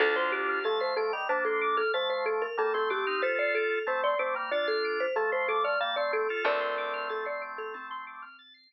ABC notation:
X:1
M:5/4
L:1/16
Q:1/4=93
K:Dphr
V:1 name="Marimba"
A c G2 A c A z c A2 A c c A B A A G2 | c d A2 c d c z d A2 c A c A d f d A2 | [Bd]4 A d z A C6 z6 |]
V:2 name="Drawbar Organ"
[DF]4 [F,A,]2 [F,A,] [E,G,] [B,D]4 [F,A,]4 [G,B,] [A,C] [A,C] [CE] | [FA]4 [A,C]2 [A,C] [G,B,] [DF]4 [F,A,]4 [G,B,] [A,C] [A,C] [FA] | [A,C]12 z8 |]
V:3 name="Drawbar Organ"
a c' d' f' a' c'' d'' f'' a c' d' f' a' c'' d'' f'' a c' d' f' | a' c'' d'' f'' a c' d' f' a' c'' d'' f'' a c' d' f' a' c'' d'' f'' | a c' d' f' a' c'' d'' f'' a c' d' f' a' c'' d'' z5 |]
V:4 name="Electric Bass (finger)" clef=bass
D,,20- | D,,20 | D,,20 |]